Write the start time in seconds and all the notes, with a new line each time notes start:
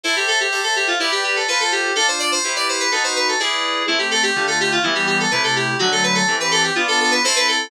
0.04 E4 A4 C5 E5
0.16 G4
0.28 A4
0.40 G4
0.52 A4 C5 E5
0.64 A4
0.76 G4
0.87 F4
1.00 E4 G4 B4 D5
1.12 G4
1.24 G4
1.36 A4
1.48 F4 A4 B4 C5
1.60 A4
1.72 G4
1.96 D4 F4 A4
2.08 C5
2.19 D5
2.32 C5
2.44 E4 G4 B4
2.56 D5
2.69 C5
2.80 B4
2.91 D#4 F#4 A4 B4
3.04 C5
3.16 B4
3.28 A4
3.40 E4 G#4 B4 D5
3.87 A3 C4 E4
3.99 G4
4.11 A4
4.23 G4
4.36 D3 A3 F4
4.47 A4
4.60 G4
4.72 F4
4.83 E3 G3 B3 E4
4.95 G4
5.07 G4
5.20 A4
5.31 C3 A3 E4 B4
5.44 A4
5.56 G4
5.79 D3 F#3 A3 F#4
5.92 A4
6.03 B4
6.15 A4
6.28 E3 C4 G4
6.40 B4
6.51 A4
6.64 G4
6.75 B3 D4 F4
6.88 A4
7.00 A4
7.11 B4
7.24 C4 E4 A4 C5
7.36 B4
7.48 A4